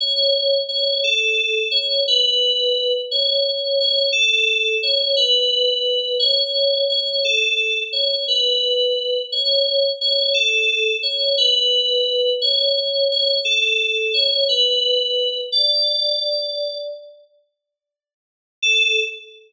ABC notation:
X:1
M:9/8
L:1/8
Q:3/8=58
K:Amix
V:1 name="Electric Piano 2"
c2 c A2 c B3 | c2 c A2 c B3 | c2 c A2 c B3 | c2 c A2 c B3 |
c2 c A2 c B3 | d4 z5 | A3 z6 |]